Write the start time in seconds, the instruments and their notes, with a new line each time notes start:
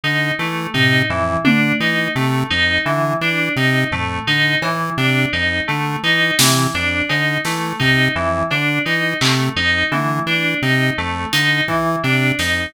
0.04 lead 1 (square) D3, electric piano 2 D#4
0.39 lead 1 (square) E3, electric piano 2 A3
0.74 lead 1 (square) C3, electric piano 2 D#4, floor tom
1.10 lead 1 (square) F2, electric piano 2 E3
1.45 lead 1 (square) D3, electric piano 2 D4, high tom
1.80 lead 1 (square) E3, electric piano 2 D#4
2.15 lead 1 (square) C3, electric piano 2 A3
2.50 lead 1 (square) F2, electric piano 2 D#4
2.86 lead 1 (square) D3, electric piano 2 E3
3.21 lead 1 (square) E3, electric piano 2 D4
3.56 lead 1 (square) C3, electric piano 2 D#4
3.91 lead 1 (square) F2, electric piano 2 A3, floor tom
4.27 lead 1 (square) D3, electric piano 2 D#4
4.62 lead 1 (square) E3, electric piano 2 E3, cowbell
4.97 lead 1 (square) C3, electric piano 2 D4
5.33 lead 1 (square) F2, electric piano 2 D#4
5.68 lead 1 (square) D3, electric piano 2 A3
6.03 lead 1 (square) E3, electric piano 2 D#4
6.39 lead 1 (square) C3, electric piano 2 E3, snare
6.74 lead 1 (square) F2, electric piano 2 D4
7.09 lead 1 (square) D3, electric piano 2 D#4, cowbell
7.45 lead 1 (square) E3, electric piano 2 A3, snare
7.80 lead 1 (square) C3, electric piano 2 D#4, kick
8.15 lead 1 (square) F2, electric piano 2 E3
8.51 lead 1 (square) D3, electric piano 2 D4, cowbell
8.85 lead 1 (square) E3, electric piano 2 D#4
9.21 lead 1 (square) C3, electric piano 2 A3, clap
9.56 lead 1 (square) F2, electric piano 2 D#4
9.92 lead 1 (square) D3, electric piano 2 E3, high tom
10.26 lead 1 (square) E3, electric piano 2 D4
10.62 lead 1 (square) C3, electric piano 2 D#4
10.98 lead 1 (square) F2, electric piano 2 A3
11.33 lead 1 (square) D3, electric piano 2 D#4, closed hi-hat
11.68 lead 1 (square) E3, electric piano 2 E3, kick
12.04 lead 1 (square) C3, electric piano 2 D4
12.39 lead 1 (square) F2, electric piano 2 D#4, snare